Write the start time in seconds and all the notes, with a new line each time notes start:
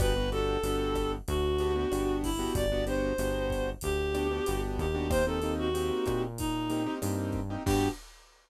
0.00 G1 B3 D4 F#4 G4 B4, kick, cross-stick, closed hi-hat
0.16 B3 D4 F#4 G4
0.32 B3 D4 F#4 G4 A4, closed hi-hat
0.63 G1 B3 D4 F#4 G4, closed hi-hat
0.95 kick, cross-stick, closed hi-hat
1.28 D2 F#4, kick, closed hi-hat
1.58 B3 D4 F#4 G4, closed hi-hat
1.76 B3 D4 F#4 G4
1.91 G1 B3 D4 F#4 G4, cross-stick, closed hi-hat
2.23 E4, kick, open hi-hat
2.39 B3 D4 F#4 G4
2.55 G1 D5, kick, closed hi-hat
2.72 B3 D4 F#4 G4
2.87 B3 D4 F#4 G4 C5, closed hi-hat
3.18 G1 B3 D4 F#4 G4, cross-stick, closed hi-hat
3.50 kick, closed hi-hat
3.81 D2 G4, kick, closed hi-hat
4.14 B3 D4 F#4 G4, cross-stick, closed hi-hat
4.31 B3 D4 F#4 G4
4.46 G1 B3 D4 F#4 G4, closed hi-hat
4.78 D#2 G4, kick, closed hi-hat
4.95 B3 D4 F#4 G4
5.10 A#3 C4 D#4 G4 C5, kick, cross-stick, closed hi-hat
5.27 A#3 C4 D#4 G4 A4
5.42 A#3 C4 D#4 G4, closed hi-hat
5.59 F#4
5.74 A#3 C4 D#4 G4, closed hi-hat
6.06 A#2, kick, cross-stick, closed hi-hat
6.38 D#4, kick, closed hi-hat
6.70 A#3 C4 D#4 G4, closed hi-hat
6.86 A#3 C4 D#4 G4
7.02 G2 A#3 C4 D#4 G4, cross-stick, closed hi-hat
7.32 kick, closed hi-hat
7.50 A#3 C4 D#4 G4
7.66 G2 B3 D4 F#4 G4, kick, crash